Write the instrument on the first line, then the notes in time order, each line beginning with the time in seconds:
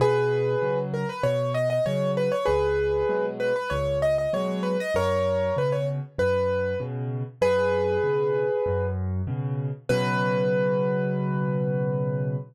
acoustic grand piano
0.00 B2 G#4 B4
0.61 C#3 F#3
0.94 A#4
1.09 B4
1.23 B2 C#5
1.54 D#5
1.70 D#5
1.86 C#3 F#3 C#5
2.17 B4
2.32 C#5
2.45 C#2 G#4 B4
3.09 B2 F#3 G#3
3.40 B4
3.56 B4
3.70 C#2 C#5
4.02 D#5
4.18 D#5
4.33 B2 F#3 G#3 C#5
4.63 B4
4.80 D#5
4.94 F#2 A#4 C#5
5.57 B2 C#3 B4
5.72 C#5
6.18 F#2 B4
6.80 B2 C#3
7.41 F#2 G#4 B4
8.03 B2 C#3
8.66 F#2
9.27 B2 C#3
9.89 B2 C#3 F#3 B4